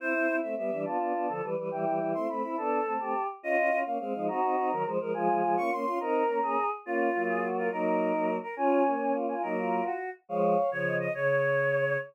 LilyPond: <<
  \new Staff \with { instrumentName = "Choir Aahs" } { \time 6/8 \key c \major \tempo 4. = 140 c''4. e''8 e''4 | a''2~ a''8 r8 | g''4. c'''8 b''4 | a''2~ a''8 r8 |
\key des \major ees''4. f''8 f''4 | bes''2~ bes''8 r8 | aes''4. des'''8 c'''4 | bes''2~ bes''8 r8 |
f'2~ f'8 f'8 | bes'2~ bes'8 bes'8 | aes''2~ aes''8 aes''8 | bes'4. ges'4 r8 |
f''4. des''4 ees''8 | des''2. | }
  \new Staff \with { instrumentName = "Choir Aahs" } { \time 6/8 \key c \major e'4. r4 d'8 | f'4. a'8 b'8 b'8 | e'2~ e'8 e'8 | a'4. g'4 r8 |
\key des \major f'4. r4 ees'8 | ges'4. bes'8 c''8 bes'8 | f'2~ f'8 f'8 | bes'4. aes'4 r8 |
f'4. aes'8 ges'8 bes'8 | ees'2~ ees'8 r8 | des'4. des'8 f'8 f'8 | ees'8 f'4. r4 |
des''4. r8 ees''8 ees''8 | des''2. | }
  \new Staff \with { instrumentName = "Choir Aahs" } { \time 6/8 \key c \major <c' e'>8 <c' e'>8 <c' e'>8 <a c'>8 <g b>8 <e g>8 | <b d'>8 <b d'>8 <b d'>8 <d f>8 <e g>8 <e g>8 | <e g>8 <e g>8 <e g>8 <a c'>8 <a c'>8 <c' e'>8 | <b d'>4 <a c'>8 <a c'>8 r4 |
\key des \major <des' f'>8 <des' f'>8 <des' f'>8 <bes des'>8 <aes c'>8 <f aes>8 | <c' ees'>8 <c' ees'>8 <c' ees'>8 <ees ges>8 <f aes>8 <f aes>8 | <f aes>8 <f aes>8 <f aes>8 <bes des'>8 <bes des'>8 <des' f'>8 | <c' ees'>4 <bes des'>8 <bes des'>8 r4 |
<bes des'>4 <ges bes>2 | <ges bes>4. <ges bes>4 r8 | <des' f'>4 <bes des'>2 | <ges bes>4. r4. |
<f aes>4 r8 <des f>4. | des2. | }
>>